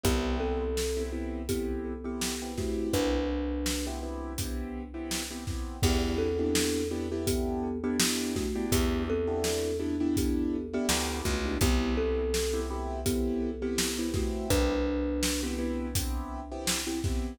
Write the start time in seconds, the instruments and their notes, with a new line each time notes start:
0.03 electric bass (finger) C2, acoustic grand piano B3 C4 E4 G4, kalimba B3 G4, kick, closed hi-hat
0.40 kalimba C4 A4
0.77 snare
0.97 acoustic grand piano B3 C4 E4 G4
1.12 acoustic grand piano B3 C4 E4 G4
1.49 kalimba B3 G4, acoustic grand piano B3 C4 E4 G4, kick, closed hi-hat
2.04 acoustic grand piano B3 C4 E4 G4, kalimba B3 G4
2.21 snare
2.42 acoustic grand piano B3 C4 E4 G4
2.58 kalimba A3 F#4, acoustic grand piano B3 C4 E4 G4, kick, snare
2.93 electric bass (finger) C2, kalimba D4 B4, kick, closed hi-hat
3.66 snare
3.87 acoustic grand piano B3 C4 E4 G4
4.03 acoustic grand piano B3 C4 E4 G4
4.38 acoustic grand piano B3 C4 E4 G4, kick, closed hi-hat
4.94 acoustic grand piano B3 C4 E4 G4
5.11 snare
5.31 acoustic grand piano B3 C4 E4 G4
5.47 acoustic grand piano B3 C4 E4 G4, kick, snare
5.83 electric bass (finger) E2, acoustic grand piano B3 D4 E4 G4, kalimba B3 G4, kick, crash
6.18 kalimba C4 A4
6.39 acoustic grand piano B3 D4 E4 G4
6.55 snare
6.91 acoustic grand piano B3 D4 E4 G4
7.12 acoustic grand piano B3 D4 E4 G4
7.27 kalimba B3 G4, kick, closed hi-hat
7.84 acoustic grand piano B3 D4 E4 G4, kalimba B3 G4
8.00 acoustic grand piano B3 D4 E4 G4, snare
8.36 kalimba A3 F#4, kick, snare
8.56 acoustic grand piano B3 D4 E4 G4
8.72 electric bass (finger) E2, kalimba B3 G4, kick, closed hi-hat
9.10 kalimba C4 A4
9.27 acoustic grand piano B3 D4 E4 G4
9.44 snare
9.80 acoustic grand piano B3 D4 E4 G4
10.00 acoustic grand piano B3 D4 E4 G4
10.17 kalimba B3 G4, kick, closed hi-hat
10.73 acoustic grand piano B3 D4 E4 G4, kalimba B3 G4
10.89 electric bass (finger) D2, acoustic grand piano B3 D4 E4 G4, snare
11.25 electric bass (finger) C#2, kalimba A3 F#4, kick, snare
11.45 acoustic grand piano B3 D4 E4 G4
11.61 electric bass (finger) C2, acoustic grand piano B3 C4 E4 G4, kalimba B3 G4, kick, closed hi-hat
11.97 kalimba C4 A4
12.34 snare
12.53 acoustic grand piano B3 C4 E4 G4
12.70 acoustic grand piano B3 C4 E4 G4
13.06 kalimba B3 G4, acoustic grand piano B3 C4 E4 G4, kick, closed hi-hat
13.62 acoustic grand piano B3 C4 E4 G4, kalimba B3 G4
13.78 snare
13.98 acoustic grand piano B3 C4 E4 G4
14.14 kalimba A3 F#4, acoustic grand piano B3 C4 E4 G4, kick, snare
14.50 electric bass (finger) C2, kalimba D4 B4, kick, closed hi-hat
15.23 snare
15.43 acoustic grand piano B3 C4 E4 G4
15.58 acoustic grand piano B3 C4 E4 G4
15.95 acoustic grand piano B3 C4 E4 G4, kick, closed hi-hat
16.52 acoustic grand piano B3 C4 E4 G4
16.67 snare
16.87 acoustic grand piano B3 C4 E4 G4
17.04 acoustic grand piano B3 C4 E4 G4, kick, snare